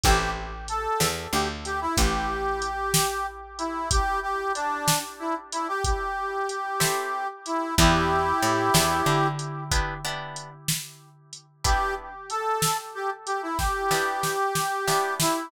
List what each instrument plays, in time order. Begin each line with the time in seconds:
0.03 electric bass (finger) A1, acoustic guitar (steel) C4 E4 G4 A4, harmonica G4, kick, closed hi-hat
0.68 harmonica A4, closed hi-hat
1.00 electric bass (finger) E2, snare
1.33 electric bass (finger) D2, harmonica G4
1.65 harmonica G4, closed hi-hat
1.81 harmonica E4
1.97 electric bass (finger) A1, harmonica G4, kick, closed hi-hat
2.62 closed hi-hat
2.94 snare
3.58 harmonica E4, closed hi-hat
3.91 harmonica G4, kick, closed hi-hat
4.22 harmonica G4
4.55 harmonica D4, closed hi-hat
4.88 snare
5.19 harmonica E4
5.52 harmonica E4, closed hi-hat
5.68 harmonica G4
5.84 harmonica G4, kick, closed hi-hat
6.49 closed hi-hat
6.80 acoustic guitar (steel) C4 E4 G4 A4, snare
7.46 harmonica E4, closed hi-hat
7.78 electric bass (finger) E2, acoustic guitar (steel) B3 D4 E4 G4, harmonica E4 G4, kick, closed hi-hat
8.42 electric bass (finger) A2, closed hi-hat
8.74 electric bass (finger) E2, acoustic guitar (steel) B3 D4 E4 G4, snare
9.06 electric bass (finger) D3
9.39 closed hi-hat
9.71 acoustic guitar (steel) B3 D4 E4 G4, kick, closed hi-hat
10.05 acoustic guitar (steel) B3 D4 E4 G4
10.36 closed hi-hat
10.68 snare
11.33 closed hi-hat
11.64 acoustic guitar (steel) B3 D4 E4 G4, harmonica G4, kick, closed hi-hat
12.30 harmonica A4, closed hi-hat
12.62 snare
12.95 harmonica G4
13.26 harmonica G4, closed hi-hat
13.42 harmonica E4
13.58 harmonica G4, kick, snare
13.91 acoustic guitar (steel) B3 D4 E4 G4, snare
14.23 snare
14.55 snare
14.87 acoustic guitar (steel) B3 D4 E4 G4, snare
15.20 harmonica E4, snare